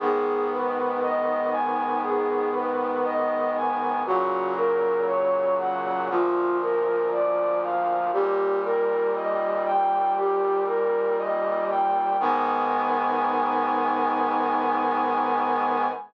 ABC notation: X:1
M:4/4
L:1/8
Q:1/4=59
K:G#m
V:1 name="Brass Section"
G B d g G B d g | F A c f ^E A =d ^e | =G A d =g G A d g | g8 |]
V:2 name="Brass Section"
[G,,D,B,]8 | [A,,C,F,]4 [=D,,A,,^E,]4 | [D,,A,,=G,]8 | [G,,D,B,]8 |]